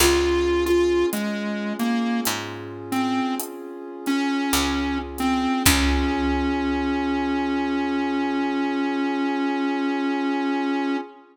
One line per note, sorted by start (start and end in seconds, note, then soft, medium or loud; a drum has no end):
0.00 1.04 C#2 loud
0.00 5.61 C#4 medium
0.00 5.61 F4 medium
0.00 0.64 F4 loud
0.00 5.61 G#4 medium
0.00 crash loud
0.66 1.06 F4 medium
0.66 closed hi-hat medium
1.13 1.73 G#3 medium
1.13 closed hi-hat medium
1.79 2.21 A#3 medium
1.79 closed hi-hat medium
2.25 3.21 G#2 medium
2.25 closed hi-hat loud
2.92 3.35 C4 medium
2.92 closed hi-hat medium
3.40 closed hi-hat loud
4.06 4.98 C#4 loud
4.06 closed hi-hat medium
4.53 5.47 C#2 medium
4.53 closed hi-hat loud
5.18 5.63 C4 loud
5.18 closed hi-hat medium
5.66 10.96 C#2 loud
5.66 10.96 C#4 loud
5.66 10.97 C#4 loud
5.66 10.96 F4 loud
5.66 10.96 G#4 loud
5.66 kick loud
5.66 crash loud